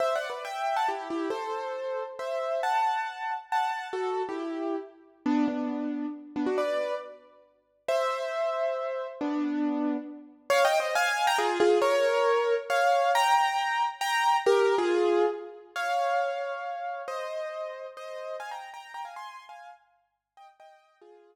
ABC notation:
X:1
M:3/4
L:1/16
Q:1/4=137
K:Em
V:1 name="Acoustic Grand Piano"
(3[ce]2 [df]2 [Bd]2 [eg]3 [fa] [EG]2 [EG]2 | [Ac]8 [ce]4 | [fa]8 [fa]4 | [FA]3 [EG]5 z4 |
[K:G] [B,D]2 [B,D]6 z2 [B,D] [DF] | [Bd]4 z8 | [ce]12 | [B,D]8 z4 |
[K:Fm] (3[df]2 [eg]2 [ce]2 [fa]3 [gb] [FA]2 [FA]2 | [Bd]8 [df]4 | [gb]8 [gb]4 | [GB]3 [FA]5 z4 |
[df]12 | [ce]8 [ce]4 | [fa] [gb]2 [gb]2 [gb] [fa] [ac']3 [fa]2 | z6 [eg] z [eg]4 |
[FA]10 z2 |]